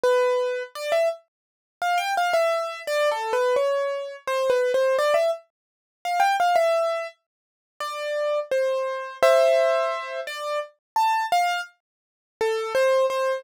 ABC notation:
X:1
M:3/4
L:1/16
Q:1/4=85
K:C
V:1 name="Acoustic Grand Piano"
B4 | d e z4 f g f e3 | (3d2 A2 B2 _d4 (3c2 B2 c2 | d e z4 f g f e3 |
z4 d4 c4 | [ce]6 d2 z2 a2 | f2 z4 A2 c2 c2 |]